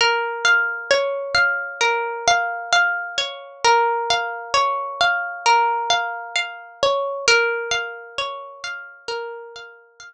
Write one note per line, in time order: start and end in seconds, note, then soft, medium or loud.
0.01 1.80 A#4 medium
0.45 1.34 F5 medium
0.91 3.17 C#5 medium
1.35 2.27 F5 medium
1.81 3.64 A#4 medium
2.28 2.72 F5 medium
2.73 4.10 F5 medium
3.18 4.53 C#5 medium
3.64 5.45 A#4 medium
4.10 5.00 F5 medium
4.54 6.82 C#5 medium
5.01 5.90 F5 medium
5.46 7.19 A#4 medium
5.90 6.35 F5 medium
6.36 7.22 F5 medium
6.83 7.26 C#5 medium
7.28 9.08 A#4 medium
7.71 8.63 F5 medium
8.18 10.13 C#5 medium
8.64 9.55 F5 medium
9.08 10.13 A#4 medium
9.56 9.99 F5 medium
10.00 10.13 F5 medium